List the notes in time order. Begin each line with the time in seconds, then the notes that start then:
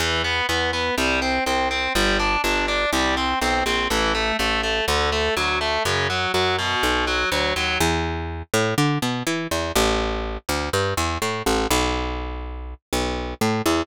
0.00 E2 E3
0.24 B3
0.49 E2 B3
0.73 B3
0.98 C2 G3
1.22 C4
1.46 C2 C4
1.71 C4
1.95 G1 G3
2.20 D4
2.44 G1 D4
2.68 D4
2.93 C2 G3
3.17 C4
3.41 B1 C4
3.66 A#1 C4
3.90 A1 E3
4.15 A3
4.39 A1 A3
4.63 A3
4.88 D2 D3
5.12 A3
5.37 D2 F#3
5.61 A3
5.85 F#2 C#3
6.10 F#3
6.34 F#2 F#3
6.59 B2
6.83 B1
7.07 F#3
7.32 D2 F#3
7.56 D#2 F#3
7.80 E2
8.54 A2
8.78 D3
9.02 B2
9.27 E3
9.51 E2
9.76 A1
10.49 D2
10.73 G2
10.97 E2
11.22 A2
11.46 A1
11.71 B1
12.93 B1
13.41 A2
13.66 E2